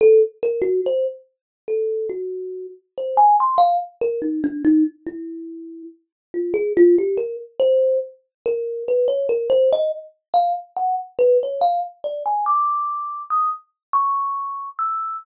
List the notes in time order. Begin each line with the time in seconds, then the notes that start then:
0.01 A4
0.43 A#4
0.62 F#4
0.86 C5
1.68 A4
2.10 F#4
2.98 C5
3.17 G#5
3.40 C6
3.58 F5
4.01 A#4
4.22 D#4
4.44 D4
4.65 D#4
5.07 E4
6.34 F4
6.54 G#4
6.77 F4
6.98 G4
7.17 A#4
7.60 C5
8.46 A#4
8.88 B4
9.08 C#5
9.29 A#4
9.50 C5
9.73 D#5
10.34 F5
10.77 F#5
11.19 B4
11.43 C#5
11.61 F5
12.04 D5
12.26 G#5
12.46 D6
13.30 D#6
13.93 C#6
14.79 E6